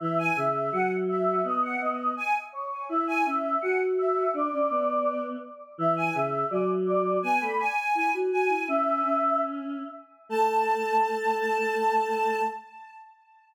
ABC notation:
X:1
M:2/2
L:1/8
Q:1/2=83
K:A
V:1 name="Choir Aahs"
e g e2 f z e2 | ^d f d2 g z c2 | e g e2 f z e2 | d5 z3 |
e g e2 d z d2 | g b g2 g z g2 | "^rit." e4 z4 | a8 |]
V:2 name="Choir Aahs"
E,2 C,2 F,4 | B,2 B,2 z4 | E2 C2 F4 | D C B,4 z2 |
E,2 C,2 F,4 | B, A, z2 E F F E | "^rit." C2 C4 z2 | A,8 |]